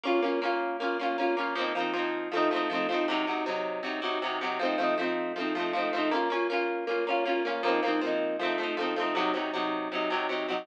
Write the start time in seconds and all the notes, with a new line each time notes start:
0.04 A#3 C#4 F4
0.22 A#3 C#4 F4
0.42 A#3 C#4 F4
0.80 A#3 C#4 F4
0.99 A#3 C#4 F4
1.18 A#3 C#4 F4
1.37 A#3 C#4 F4
1.55 F3 A#3 C4
1.61 D#4
1.75 F3 A#3 C4
1.80 D#4
1.93 F3 A#3 C4
1.99 D#4
2.32 F3 A3 C4
2.37 D#4
2.51 F3 A3 C4
2.56 D#4
2.70 F3 A3 C4
2.75 D#4
2.89 F3 A3 C4
2.94 D#4
3.08 C3 F#3 D#4
3.27 C3 F#3 D#4
3.46 C3 F#3 D#4
3.83 C3 F#3 D#4
4.02 C3 F#3 D#4
4.22 C3 F#3 D#4
4.41 C3 F#3 D#4
4.59 F3 A3 C4
4.65 D#4
4.78 F3 A3 C4
4.83 D#4
4.98 F3 A3 C4
5.03 D#4
5.36 F3 A3 C4
5.41 D#4
5.55 F3 A3 C4
5.60 D#4
5.73 F3 A3 C4
5.78 D#4
5.93 F3 A3 C4
5.98 D#4
6.11 A#3 C#4 F4
6.30 A#3 C#4 F4
6.50 A#3 C#4 F4
6.87 A#3 C#4 F4
7.07 A#3 C#4 F4
7.25 A#3 C#4 F4
7.45 A#3 C#4 F4
7.63 F3 A#3 C4
7.68 D#4
7.83 F3 A#3 C4
7.88 D#4
8.01 F3 A#3 C4
8.07 D#4
8.39 F3 A3 C4
8.45 D#4
8.58 F3 A3 C4
8.63 D#4
8.77 F3 A3 C4
8.82 D#4
8.96 F3 A3 C4
9.02 D#4
9.15 C3 F#3 D#4
9.34 C3 F#3 D#4
9.54 C3 F#3 D#4
9.92 C3 F#3 D#4
10.10 C3 F#3 D#4
10.29 C3 F#3 D#4
10.48 C3 F#3 D#4